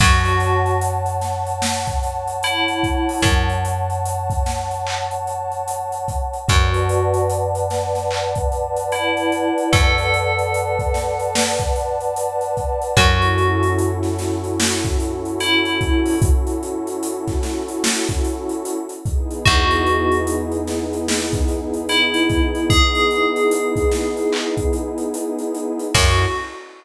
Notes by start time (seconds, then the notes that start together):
0.00 F#2 F#4 C#5 F#5 A5, kick, crash
0.25 closed hi-hat
0.40 closed hi-hat
0.66 closed hi-hat
0.81 closed hi-hat
1.06 closed hi-hat
1.21 snare, closed hi-hat
1.47 closed hi-hat
1.62 snare
1.87 kick, closed hi-hat
2.03 closed hi-hat
2.28 closed hi-hat
2.43 E4, closed hi-hat
2.68 closed hi-hat
2.83 kick, closed hi-hat
3.09 open hi-hat
3.22 F#2, kick, closed hi-hat
3.49 closed hi-hat
3.65 closed hi-hat
3.90 closed hi-hat
4.06 closed hi-hat
4.30 kick, closed hi-hat
4.46 snare, closed hi-hat
4.71 closed hi-hat
4.87 clap
5.11 closed hi-hat
5.27 closed hi-hat
5.52 closed hi-hat
5.68 closed hi-hat
5.92 closed hi-hat
6.08 kick, closed hi-hat
6.33 closed hi-hat
6.48 F#2 F#4 B4 D5 F#5 A5, kick, closed hi-hat
6.74 closed hi-hat
6.89 closed hi-hat
7.14 closed hi-hat
7.30 closed hi-hat
7.55 closed hi-hat
7.70 snare, closed hi-hat
7.95 snare, closed hi-hat
8.11 clap
8.35 kick, closed hi-hat
8.52 closed hi-hat
8.77 closed hi-hat
8.92 E4, closed hi-hat
9.17 closed hi-hat
9.32 closed hi-hat
9.58 closed hi-hat
9.73 F#2 A4, kick, closed hi-hat
9.98 closed hi-hat
10.14 closed hi-hat
10.39 closed hi-hat
10.54 closed hi-hat
10.79 kick, closed hi-hat
10.94 snare, closed hi-hat
11.19 closed hi-hat
11.35 snare
11.59 kick, closed hi-hat
11.76 closed hi-hat
12.01 closed hi-hat
12.16 closed hi-hat
12.41 closed hi-hat
12.57 kick, closed hi-hat
12.82 closed hi-hat
12.97 F#2 C#4 E4 F#4 A4, kick, closed hi-hat
13.22 closed hi-hat
13.38 closed hi-hat
13.63 closed hi-hat
13.79 closed hi-hat
14.03 snare, closed hi-hat
14.19 snare, closed hi-hat
14.44 closed hi-hat
14.60 snare
14.85 kick, closed hi-hat
15.00 closed hi-hat
15.25 closed hi-hat
15.40 E4, closed hi-hat
15.65 closed hi-hat
15.81 kick, closed hi-hat
16.06 open hi-hat
16.22 kick, closed hi-hat
16.47 closed hi-hat
16.63 closed hi-hat
16.87 closed hi-hat
17.03 closed hi-hat
17.28 kick, snare, closed hi-hat
17.43 snare, closed hi-hat
17.68 closed hi-hat
17.84 snare
18.08 kick, closed hi-hat
18.24 closed hi-hat
18.49 closed hi-hat
18.65 closed hi-hat
18.89 closed hi-hat
19.05 B3 D#4 E4 G#4, kick, closed hi-hat
19.31 closed hi-hat
19.45 E2 F#4, kick, closed hi-hat
19.71 closed hi-hat
19.86 closed hi-hat
20.12 closed hi-hat
20.27 closed hi-hat
20.52 closed hi-hat
20.67 snare, closed hi-hat
20.93 closed hi-hat
21.08 snare
21.33 kick, closed hi-hat
21.48 closed hi-hat
21.74 closed hi-hat
21.89 E4, closed hi-hat
22.14 closed hi-hat
22.30 kick, closed hi-hat
22.55 closed hi-hat
22.70 G#4, kick, closed hi-hat
22.95 closed hi-hat
23.11 closed hi-hat
23.36 closed hi-hat
23.51 closed hi-hat
23.76 kick, closed hi-hat
23.92 snare, closed hi-hat
24.17 closed hi-hat
24.33 clap
24.57 kick, closed hi-hat
24.73 closed hi-hat
24.98 closed hi-hat
25.14 closed hi-hat
25.39 closed hi-hat
25.55 closed hi-hat
25.79 closed hi-hat
25.94 F#2 C#4 E4 F#4 A4, kick, crash